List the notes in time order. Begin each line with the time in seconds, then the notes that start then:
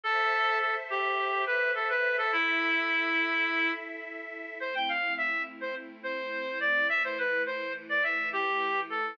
0.03 A4 C5 E5
0.60 A4
0.90 G4
1.46 B4
1.75 A4
1.89 B4
2.18 A4
2.32 E4 A4 E5
4.60 A3 C4 E4 C5
4.75 G5
4.89 F5
5.17 E5
5.61 C5
6.03 C5
6.60 D5
6.89 E3 A3 E4 E5
7.04 C5
7.18 B4
7.46 C5
7.89 D5
8.03 E5
8.33 G4
8.90 A4